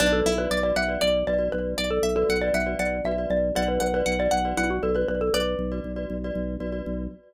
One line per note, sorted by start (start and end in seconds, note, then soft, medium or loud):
0.00 0.22 B1 loud
0.00 0.20 D4 medium
0.00 0.29 F#4 loud
0.00 0.29 B4 loud
0.00 0.12 D5 medium
0.00 0.29 D5 loud
0.13 0.34 A4 medium
0.26 0.47 B1 medium
0.26 0.49 E4 medium
0.37 0.58 F#4 loud
0.37 0.58 B4 loud
0.37 0.60 B4 medium
0.37 0.58 D5 medium
0.51 0.72 B1 medium
0.51 0.75 D5 medium
0.63 0.83 F#4 loud
0.63 0.83 B4 medium
0.63 0.83 D5 medium
0.63 0.75 D5 medium
0.76 0.97 B1 medium
0.76 1.00 E5 medium
0.76 1.01 F#5 medium
0.88 1.19 F#4 medium
0.88 1.19 B4 medium
0.88 1.19 D5 medium
1.01 1.24 B1 medium
1.01 1.26 D5 medium
1.01 1.24 D5 medium
1.27 1.49 B1 medium
1.27 1.38 F#4 medium
1.27 1.38 B4 medium
1.27 1.49 D5 medium
1.27 1.38 D5 medium
1.38 1.79 F#4 medium
1.38 1.79 B4 medium
1.38 1.79 D5 medium
1.52 1.75 B1 medium
1.52 1.73 B4 medium
1.78 2.00 B1 medium
1.78 1.90 D5 medium
1.78 2.03 D5 medium
1.91 2.15 A4 medium
2.03 2.24 B1 medium
2.03 2.27 E5 medium
2.16 2.36 F#4 loud
2.16 2.39 A4 medium
2.16 2.36 B4 medium
2.16 2.36 D5 medium
2.29 2.51 B1 medium
2.29 2.53 F#5 medium
2.42 2.63 F#4 medium
2.42 2.63 B4 medium
2.42 2.54 D5 medium
2.42 2.63 D5 medium
2.54 2.75 B1 medium
2.54 2.78 E5 medium
2.54 2.76 F#5 medium
2.66 2.97 F#4 medium
2.66 2.97 B4 medium
2.66 2.97 D5 loud
2.79 3.01 B1 medium
2.79 3.04 D5 medium
2.79 3.01 F#5 medium
3.04 3.26 B1 medium
3.04 3.16 F#4 loud
3.04 3.16 B4 loud
3.04 3.16 D5 loud
3.04 3.29 E5 medium
3.18 3.49 F#4 medium
3.18 3.49 B4 medium
3.18 3.49 D5 medium
3.30 3.52 B1 medium
3.30 3.53 D5 medium
3.55 3.78 B1 loud
3.55 3.86 F#4 loud
3.55 3.86 B4 loud
3.55 3.86 D5 loud
3.55 3.68 D5 medium
3.55 3.78 F#5 medium
3.68 3.80 B4 medium
3.80 4.03 B1 medium
3.80 3.94 B4 medium
3.80 4.01 F#5 medium
3.94 4.15 F#4 medium
3.94 4.19 B4 medium
3.94 4.15 B4 loud
3.94 4.15 D5 medium
4.06 4.28 B1 medium
4.06 4.27 F#5 medium
4.19 4.39 F#4 loud
4.19 4.39 B4 medium
4.19 4.39 D5 medium
4.19 4.32 D5 medium
4.31 4.54 B1 medium
4.31 4.55 F#5 medium
4.45 4.75 F#4 loud
4.45 4.75 B4 loud
4.45 4.75 D5 medium
4.57 4.80 B1 medium
4.57 4.69 E4 medium
4.57 4.81 F#5 medium
4.70 4.82 F#4 medium
4.83 5.05 B1 medium
4.83 4.93 F#4 medium
4.83 4.95 A4 medium
4.83 4.93 B4 loud
4.83 4.93 D5 medium
4.94 5.35 F#4 medium
4.94 5.35 B4 medium
4.94 5.08 B4 medium
4.94 5.35 D5 loud
5.08 5.30 B1 medium
5.08 5.20 B4 medium
5.21 5.33 A4 medium
5.34 5.55 B1 medium
5.34 6.08 B4 medium
5.34 6.48 D5 medium
5.59 5.80 B1 medium
5.72 5.92 F#4 medium
5.72 5.92 B4 medium
5.72 5.92 D5 medium
5.84 6.06 B1 medium
5.96 6.17 F#4 medium
5.96 6.17 B4 medium
5.96 6.17 D5 loud
6.10 6.31 B1 medium
6.24 6.55 F#4 loud
6.24 6.55 B4 medium
6.24 6.55 D5 loud
6.35 6.57 B1 medium
6.60 6.82 B1 medium
6.60 6.70 F#4 loud
6.60 6.70 B4 medium
6.60 6.70 D5 medium
6.72 7.03 F#4 medium
6.72 7.03 B4 medium
6.72 7.03 D5 medium
6.86 7.08 B1 medium